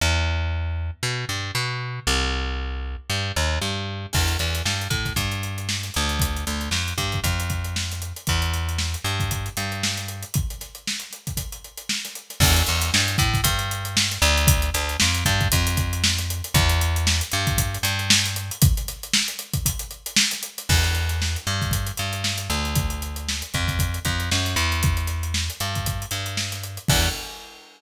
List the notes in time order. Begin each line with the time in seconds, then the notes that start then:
0.01 E2
1.03 B2
1.29 G2
1.55 B2
2.07 C2
3.10 G2
3.36 D#2
3.62 G2
4.13 E2, kick, crash
4.28 closed hi-hat
4.39 E2, closed hi-hat
4.55 snare, closed hi-hat
4.65 G2, snare
4.81 closed hi-hat
4.90 A2, kick, closed hi-hat
5.05 kick, snare, closed hi-hat
5.16 G2, kick, closed hi-hat
5.32 closed hi-hat
5.43 closed hi-hat
5.58 closed hi-hat
5.69 snare
5.83 snare, closed hi-hat
5.94 D2, closed hi-hat
6.09 closed hi-hat
6.20 kick, closed hi-hat
6.37 closed hi-hat
6.47 D2, closed hi-hat
6.61 closed hi-hat
6.71 F2, snare
6.88 closed hi-hat
6.98 G2, kick, closed hi-hat
7.12 kick, closed hi-hat
7.24 F2, kick, closed hi-hat
7.40 closed hi-hat
7.49 kick, snare, closed hi-hat
7.64 closed hi-hat
7.76 snare
7.91 snare, closed hi-hat
8.02 closed hi-hat
8.16 closed hi-hat
8.27 E2, kick, closed hi-hat
8.42 closed hi-hat
8.54 snare, closed hi-hat
8.69 closed hi-hat
8.78 snare
8.94 closed hi-hat
9.04 G2, closed hi-hat
9.20 kick, closed hi-hat
9.31 kick, closed hi-hat
9.46 closed hi-hat
9.57 G2, closed hi-hat
9.72 closed hi-hat
9.83 snare
9.97 snare, closed hi-hat
10.08 closed hi-hat
10.23 closed hi-hat
10.34 kick, closed hi-hat
10.50 closed hi-hat
10.61 snare, closed hi-hat
10.75 closed hi-hat
10.87 snare
11.00 closed hi-hat
11.11 snare, closed hi-hat
11.27 kick, closed hi-hat
11.37 kick, closed hi-hat
11.52 closed hi-hat
11.64 closed hi-hat
11.77 closed hi-hat
11.89 snare
12.05 snare, closed hi-hat
12.15 closed hi-hat
12.30 snare, closed hi-hat
12.40 E2, kick, crash
12.56 closed hi-hat
12.66 E2, closed hi-hat
12.81 snare, closed hi-hat
12.94 G2, snare
13.08 closed hi-hat
13.18 A2, kick, closed hi-hat
13.34 kick, snare, closed hi-hat
13.44 G2, kick, closed hi-hat
13.59 closed hi-hat
13.71 closed hi-hat
13.85 closed hi-hat
13.97 snare
14.11 snare, closed hi-hat
14.22 D2, closed hi-hat
14.37 closed hi-hat
14.47 kick, closed hi-hat
14.62 closed hi-hat
14.74 D2, closed hi-hat
14.89 closed hi-hat
15.00 F2, snare
15.15 closed hi-hat
15.25 G2, kick, closed hi-hat
15.41 kick, closed hi-hat
15.52 F2, kick, closed hi-hat
15.67 closed hi-hat
15.76 kick, snare, closed hi-hat
15.93 closed hi-hat
16.04 snare
16.18 snare, closed hi-hat
16.30 closed hi-hat
16.44 closed hi-hat
16.54 E2, kick, closed hi-hat
16.69 closed hi-hat
16.81 snare, closed hi-hat
16.96 closed hi-hat
17.07 snare
17.21 closed hi-hat
17.32 G2, closed hi-hat
17.47 kick, closed hi-hat
17.58 kick, closed hi-hat
17.74 closed hi-hat
17.83 G2, closed hi-hat
17.99 closed hi-hat
18.10 snare
18.24 snare, closed hi-hat
18.36 closed hi-hat
18.51 closed hi-hat
18.62 kick, closed hi-hat
18.77 closed hi-hat
18.88 snare, closed hi-hat
19.03 closed hi-hat
19.13 snare
19.28 closed hi-hat
19.39 snare, closed hi-hat
19.53 kick, closed hi-hat
19.66 kick, closed hi-hat
19.79 closed hi-hat
19.91 closed hi-hat
20.06 closed hi-hat
20.16 snare
20.31 snare, closed hi-hat
20.43 closed hi-hat
20.58 snare, closed hi-hat
20.69 E2, kick, crash
20.84 closed hi-hat
20.95 closed hi-hat
21.09 closed hi-hat
21.22 snare
21.36 closed hi-hat
21.47 G2, closed hi-hat
21.61 kick, snare, closed hi-hat
21.71 kick, closed hi-hat
21.87 closed hi-hat
21.97 G2, closed hi-hat
22.13 closed hi-hat
22.24 snare
22.37 snare, closed hi-hat
22.50 D2, closed hi-hat
22.65 closed hi-hat
22.75 kick, closed hi-hat
22.90 closed hi-hat
23.02 closed hi-hat
23.16 closed hi-hat
23.29 snare
23.42 closed hi-hat
23.54 F2, kick, closed hi-hat
23.68 kick, snare, closed hi-hat
23.79 kick, closed hi-hat
23.94 closed hi-hat
24.05 F2, kick, closed hi-hat
24.20 closed hi-hat
24.31 F#2, snare
24.45 snare, closed hi-hat
24.56 E2, closed hi-hat
24.71 snare, closed hi-hat
24.83 kick, closed hi-hat
24.97 closed hi-hat
25.07 snare, closed hi-hat
25.23 closed hi-hat
25.34 snare
25.50 closed hi-hat
25.60 G2, closed hi-hat
25.75 kick, closed hi-hat
25.86 kick, closed hi-hat
26.02 closed hi-hat
26.11 G2, closed hi-hat
26.26 closed hi-hat
26.37 snare
26.52 snare, closed hi-hat
26.63 closed hi-hat
26.77 closed hi-hat
26.88 E2, kick, crash